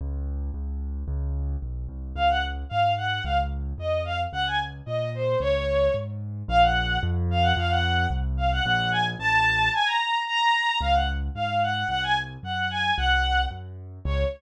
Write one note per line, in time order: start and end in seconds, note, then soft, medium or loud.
0.01 0.51 C#2 medium
0.54 1.04 C#2 medium
1.08 1.56 C#2 medium
1.62 1.87 B1 medium
1.89 2.13 C2 medium
2.15 2.64 C#2 medium
2.15 2.28 F5 loud
2.30 2.43 F#5 medium
2.69 3.20 G#2 medium
2.69 2.92 F5 medium
2.97 3.22 F#5 medium
3.24 3.73 C#2 medium
3.24 3.37 F5 medium
3.78 4.27 F2 medium
3.78 4.02 D#5 medium
4.05 4.18 F5 medium
4.33 4.81 C#2 medium
4.33 4.45 F#5 loud
4.47 4.60 G#5 medium
4.86 5.35 A#2 medium
4.86 5.10 D#5 medium
5.15 5.39 C5 medium
5.40 5.89 C#2 medium
5.40 5.91 C#5 loud
5.94 6.43 G#2 medium
6.48 6.98 A#1 loud
6.48 6.62 F5 loud
6.62 6.98 F#5 medium
7.03 7.53 F2 loud
7.31 7.43 F5 loud
7.42 7.55 F#5 loud
7.57 8.07 F2 loud
7.57 7.70 F5 loud
7.70 8.06 F#5 loud
8.10 8.60 C2 medium
8.37 8.50 F5 medium
8.52 8.64 F#5 loud
8.65 9.15 A#1 loud
8.65 8.90 F#5 loud
8.91 9.04 G#5 medium
9.19 9.69 A1 loud
9.19 9.71 A5 loud
9.74 9.86 G#5 loud
9.86 10.20 A#5 medium
10.26 10.78 A#5 loud
10.81 11.29 C#2 medium
10.81 10.94 F5 loud
10.94 11.07 F#5 medium
11.35 11.84 G#2 medium
11.35 11.61 F5 medium
11.63 11.88 F#5 medium
11.88 12.37 C2 medium
11.88 12.01 F#5 loud
12.03 12.16 G#5 loud
12.43 12.92 F#2 medium
12.43 12.69 F#5 medium
12.70 12.93 G#5 medium
12.97 13.46 C2 medium
12.97 13.41 F#5 loud
13.51 13.99 F#2 medium
14.05 14.24 C#2 loud
14.05 14.24 C#5 loud